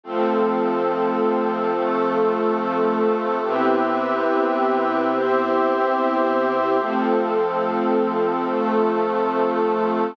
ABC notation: X:1
M:6/8
L:1/8
Q:3/8=71
K:Cmix
V:1 name="String Ensemble 1"
[F,A,C]6- | [F,A,C]6 | [C,=B,EG]6- | [C,=B,EG]6 |
[F,A,C]6- | [F,A,C]6 |]
V:2 name="Pad 2 (warm)"
[F,CA]6 | [F,A,A]6 | [CG=Be]6 | [CGce]6 |
[F,CA]6 | [F,A,A]6 |]